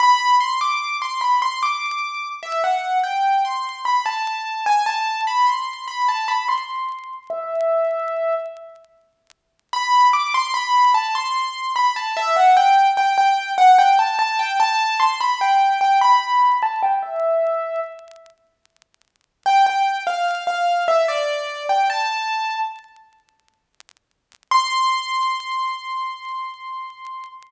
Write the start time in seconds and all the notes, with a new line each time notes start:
0.00 B5
0.41 C6
0.61 D6
1.02 C6
1.21 B5
1.42 C6
1.63 D6
2.43 E5
2.64 F#5
3.04 G5
3.45 C6
3.85 B5
4.06 A5
4.66 G#5
4.86 A5
5.27 B5
5.47 C6
5.88 B5
6.08 A5
6.28 B5
6.48 C6
7.30 E5
9.73 B5
10.13 D6
10.34 C6
10.54 B5
10.94 A5
11.15 C6
11.76 B5
11.96 A5
12.17 E5
12.36 F#5
12.57 G5
12.97 G5
13.18 G5
13.58 F#5
13.79 G5
13.99 A5
14.19 A5
14.39 G5
14.60 A5
15.00 C6
15.20 B5
15.41 G5
15.81 G5
16.01 B5
16.63 A5
16.83 G5
17.03 E5
19.46 G5
19.66 G5
20.07 F5
20.47 F5
20.88 E5
21.08 D5
21.69 G5
21.90 A5
24.51 C6